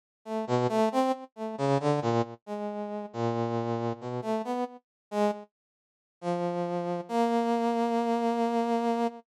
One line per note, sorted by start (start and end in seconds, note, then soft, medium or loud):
0.25 0.45 A3 medium
0.47 0.67 B2 loud
0.69 0.89 A3 loud
0.92 1.12 C4 loud
1.36 1.56 A3 medium
1.58 1.78 C#3 loud
1.80 2.00 D3 loud
2.02 2.22 A#2 loud
2.46 3.06 G#3 medium
3.13 3.93 A#2 medium
4.01 4.21 B2 medium
4.22 4.42 A3 medium
4.44 4.64 B3 medium
5.11 5.31 G#3 loud
6.21 7.01 F3 medium
7.09 9.07 A#3 loud